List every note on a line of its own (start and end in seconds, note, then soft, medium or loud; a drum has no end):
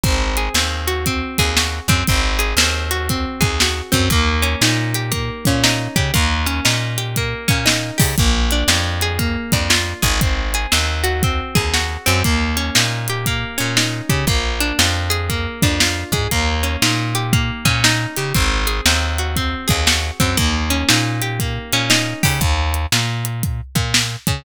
0.03 0.49 G#1 loud
0.03 0.54 C4 loud
0.03 kick loud
0.03 closed hi-hat loud
0.37 1.38 G#4 medium
0.37 closed hi-hat medium
0.54 1.23 D#2 medium
0.54 1.06 C4 medium
0.54 snare loud
0.88 1.57 F#4 medium
0.88 closed hi-hat medium
1.06 1.89 C4 medium
1.06 kick medium
1.06 closed hi-hat loud
1.38 1.80 D#2 medium
1.38 2.05 G#4 medium
1.38 kick medium
1.38 closed hi-hat medium
1.57 2.07 F#4 medium
1.57 snare loud
1.88 2.04 F#2 medium
1.88 2.07 C4 medium
1.88 kick medium
1.88 closed hi-hat medium
2.07 2.54 G#1 loud
2.07 2.58 C4 medium
2.07 kick loud
2.07 closed hi-hat loud
2.39 3.40 G#4 medium
2.39 closed hi-hat medium
2.57 3.26 D#2 loud
2.57 3.09 C4 medium
2.57 snare loud
2.91 3.61 F#4 medium
2.91 closed hi-hat medium
3.09 3.91 C4 medium
3.09 kick medium
3.09 closed hi-hat loud
3.41 3.82 D#2 medium
3.41 4.07 G#4 medium
3.41 kick medium
3.41 closed hi-hat medium
3.60 4.11 F#4 medium
3.60 snare loud
3.92 4.09 F#2 loud
3.92 4.09 C4 medium
3.92 kick medium
3.92 closed hi-hat medium
4.10 4.55 D#2 loud
4.10 5.11 A#3 loud
4.10 kick loud
4.10 closed hi-hat loud
4.42 5.46 C#4 medium
4.42 closed hi-hat medium
4.61 5.30 A#2 medium
4.61 5.63 D#4 medium
4.61 snare loud
4.94 5.95 G4 medium
4.94 closed hi-hat medium
5.12 6.10 A#3 medium
5.12 kick medium
5.12 closed hi-hat loud
5.45 5.88 A#2 medium
5.45 6.13 C#4 medium
5.45 kick medium
5.45 closed hi-hat medium
5.64 6.13 D#4 medium
5.64 snare loud
5.96 6.11 C#3 medium
5.96 6.13 G4 medium
5.96 kick medium
5.96 closed hi-hat medium
6.14 6.60 D#2 loud
6.14 7.17 A#3 medium
6.14 kick loud
6.14 closed hi-hat loud
6.46 7.48 C#4 medium
6.46 closed hi-hat medium
6.65 7.34 A#2 medium
6.65 7.65 D#4 medium
6.65 snare loud
6.98 7.97 G4 medium
6.98 closed hi-hat medium
7.16 8.15 A#3 medium
7.16 kick medium
7.16 closed hi-hat loud
7.48 7.91 A#2 medium
7.48 8.14 C#4 medium
7.48 kick medium
7.48 closed hi-hat medium
7.66 8.15 D#4 medium
7.66 snare loud
7.98 8.15 C#3 medium
7.98 8.15 G4 medium
7.98 kick medium
7.98 open hi-hat medium
8.18 8.64 A#1 loud
8.18 9.18 A#3 medium
8.18 kick loud
8.18 closed hi-hat loud
8.51 9.52 D4 medium
8.51 closed hi-hat medium
8.68 9.37 F2 loud
8.68 9.69 F4 medium
8.68 snare loud
9.01 10.02 G#4 medium
9.01 closed hi-hat medium
9.19 10.17 A#3 medium
9.19 kick medium
9.19 closed hi-hat loud
9.52 9.94 F2 medium
9.52 10.19 D4 medium
9.52 kick medium
9.52 closed hi-hat medium
9.70 10.19 F4 medium
9.70 snare loud
10.02 10.67 G#1 loud
10.02 10.20 G#4 medium
10.02 kick medium
10.02 closed hi-hat medium
10.21 10.71 C4 medium
10.21 kick loud
10.21 closed hi-hat loud
10.54 11.55 G#4 medium
10.54 closed hi-hat medium
10.72 11.41 D#2 loud
10.72 11.23 C4 medium
10.72 snare loud
11.04 11.74 F#4 medium
11.04 closed hi-hat medium
11.23 12.06 C4 medium
11.23 kick loud
11.23 closed hi-hat loud
11.55 11.97 D#2 medium
11.55 12.22 G#4 medium
11.55 kick medium
11.55 closed hi-hat medium
11.74 12.23 F#4 medium
11.74 snare medium
12.06 12.23 F#2 loud
12.06 12.23 C4 medium
12.06 closed hi-hat medium
12.24 12.70 D#2 loud
12.24 13.26 A#3 loud
12.24 kick loud
12.24 closed hi-hat loud
12.57 13.57 C#4 medium
12.57 closed hi-hat medium
12.75 13.45 A#2 loud
12.75 13.76 D#4 medium
12.75 snare loud
13.08 14.09 G4 medium
13.08 closed hi-hat medium
13.26 14.25 A#3 medium
13.26 kick medium
13.26 closed hi-hat loud
13.58 14.01 A#2 medium
13.58 14.24 C#4 medium
13.58 closed hi-hat medium
13.77 14.26 D#4 medium
13.77 snare loud
14.09 14.25 C#3 medium
14.09 14.27 G4 medium
14.09 kick medium
14.09 closed hi-hat medium
14.27 14.72 A#1 medium
14.27 15.29 A#3 loud
14.27 kick loud
14.27 closed hi-hat loud
14.60 15.62 D4 medium
14.60 closed hi-hat medium
14.79 15.48 F2 medium
14.79 15.81 F4 medium
14.79 snare loud
15.10 16.13 G#4 medium
15.10 closed hi-hat medium
15.30 16.28 A#3 medium
15.30 kick medium
15.30 closed hi-hat loud
15.62 16.04 F2 medium
15.62 16.29 D4 medium
15.62 kick medium
15.62 closed hi-hat medium
15.80 16.30 F4 medium
15.80 snare loud
16.12 16.28 G#2 medium
16.12 16.31 G#4 medium
16.12 kick medium
16.12 closed hi-hat medium
16.31 16.77 D#2 loud
16.31 17.32 A#3 loud
16.31 kick medium
16.31 closed hi-hat loud
16.63 17.65 C#4 medium
16.63 closed hi-hat medium
16.82 17.51 A#2 loud
16.82 17.84 D#4 medium
16.82 snare loud
17.15 18.17 G4 medium
17.15 closed hi-hat medium
17.33 18.31 A#3 medium
17.33 kick loud
17.33 closed hi-hat medium
17.65 18.06 A#2 loud
17.65 18.32 C#4 medium
17.65 kick medium
17.65 closed hi-hat medium
17.84 18.33 D#4 medium
17.84 snare loud
18.17 18.33 C#3 medium
18.17 18.34 G4 medium
18.17 closed hi-hat medium
18.34 18.81 G#1 loud
18.34 18.85 C4 loud
18.34 kick loud
18.34 closed hi-hat loud
18.67 19.67 G#4 medium
18.67 closed hi-hat medium
18.86 19.54 D#2 medium
18.86 19.36 C4 medium
18.86 snare loud
19.18 19.86 F#4 medium
19.18 closed hi-hat medium
19.36 20.19 C4 medium
19.36 kick medium
19.36 closed hi-hat loud
19.68 20.11 D#2 loud
19.68 20.34 G#4 medium
19.68 kick medium
19.68 closed hi-hat medium
19.87 20.36 F#4 medium
19.87 snare loud
20.20 20.36 F#2 medium
20.20 20.37 C4 medium
20.20 kick medium
20.20 closed hi-hat medium
20.37 20.84 D#2 loud
20.37 21.40 A#3 loud
20.37 kick loud
20.37 closed hi-hat loud
20.70 21.73 C#4 medium
20.70 closed hi-hat medium
20.89 21.59 A#2 loud
20.89 21.89 D#4 medium
20.89 snare loud
21.22 22.23 G4 medium
21.22 closed hi-hat medium
21.40 22.38 A#3 medium
21.40 kick medium
21.40 closed hi-hat loud
21.73 22.14 A#2 medium
21.73 22.39 C#4 medium
21.73 closed hi-hat medium
21.90 22.39 D#4 medium
21.90 snare loud
22.23 22.40 C#3 medium
22.23 22.40 G4 medium
22.23 kick medium
22.23 open hi-hat medium
22.41 22.86 D#2 loud
22.41 kick loud
22.41 closed hi-hat loud
22.74 closed hi-hat medium
22.92 23.61 A#2 medium
22.92 snare loud
23.25 closed hi-hat medium
23.43 kick loud
23.43 closed hi-hat loud
23.75 24.16 A#2 medium
23.75 kick medium
23.75 closed hi-hat medium
23.94 snare loud
24.27 24.43 C#3 medium
24.27 kick medium
24.27 closed hi-hat medium